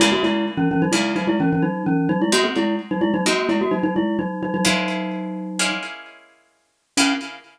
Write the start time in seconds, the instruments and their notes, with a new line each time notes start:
0.00 pizzicato strings C#3 A#3 E4 G#4, glockenspiel G#3 E4
0.12 glockenspiel A#3 F#4
0.23 glockenspiel G#3 E4
0.57 glockenspiel E3 C#4
0.71 glockenspiel E3 C#4
0.82 glockenspiel F#3 D#4
0.92 pizzicato strings C#3 A#3 E4 G#4, glockenspiel G#3 E4
1.16 glockenspiel F#3 D#4
1.27 glockenspiel G#3 E4
1.40 glockenspiel E3 C#4
1.53 glockenspiel E3 C#4
1.62 glockenspiel F#3 D#4
1.86 glockenspiel E3 C#4
2.09 glockenspiel F#3 D#4
2.22 glockenspiel G#3 E4
2.32 pizzicato strings G#3 C4 D#4 F#4, glockenspiel A#3 F#4
2.44 glockenspiel C4 G#4
2.56 glockenspiel G#3 E4
2.91 glockenspiel F#3 D#4
3.01 glockenspiel G#3 E4
3.14 glockenspiel F#3 D#4
3.26 pizzicato strings G#3 C4 D#4 F#4, glockenspiel A#3 F#4
3.49 glockenspiel G#3 E4
3.61 glockenspiel A#3 F#4
3.71 glockenspiel F#3 D#4
3.83 glockenspiel F#3 D#4
3.96 glockenspiel G#3 E4
4.19 glockenspiel F#3 D#4
4.43 glockenspiel F#3 D#4
4.54 glockenspiel F#3 D#4
4.65 glockenspiel F#3 D#4, pizzicato strings G#3 A#3 C#4 E4
5.59 pizzicato strings G#3 A#3 C#4 E4
6.97 pizzicato strings C#3 A#3 E4 G#4, glockenspiel C#4